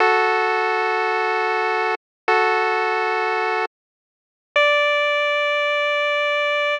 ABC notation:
X:1
M:3/4
L:1/8
Q:1/4=79
K:D
V:1 name="Lead 1 (square)"
[FA]6 | [FA]4 z2 | d6 |]